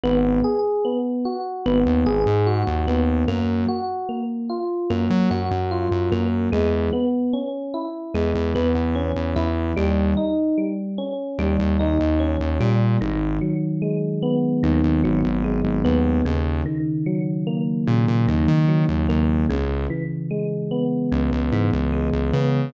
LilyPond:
<<
  \new Staff \with { instrumentName = "Synth Bass 1" } { \clef bass \time 4/4 \key gis \minor \tempo 4 = 74 gis,,2 gis,,16 dis,16 gis,,16 gis,8 dis,16 dis,8 | fis,2 fis,16 fis16 fis,16 fis,8 fis,16 fis,8 | e,2 e,16 e,16 e,16 e,8 e,16 e,8 | dis,2 dis,16 dis,16 dis,16 dis,8 dis,16 ais,8 |
gis,,2 dis,16 dis,16 gis,,16 gis,,8 gis,,16 dis,8 | dis,2 ais,16 ais,16 dis,16 dis8 dis,16 dis,8 | cis,2 cis,16 cis,16 gis,16 cis,8 cis,16 cis8 | }
  \new Staff \with { instrumentName = "Electric Piano 1" } { \time 4/4 \key gis \minor b8 gis'8 b8 fis'8 b8 gis'8 fis'8 b8 | ais8 fis'8 ais8 eis'8 ais8 fis'8 eis'8 ais8 | gis8 b8 cis'8 e'8 gis8 b8 cis'8 e'8 | g8 dis'8 g8 cis'8 g8 dis'8 cis'8 g8 |
dis8 fis8 gis8 b8 dis8 fis8 gis8 b8 | cis8 dis8 fis8 ais8 cis8 dis8 fis8 ais8 | cis8 e8 gis8 b8 cis8 e8 gis8 b8 | }
>>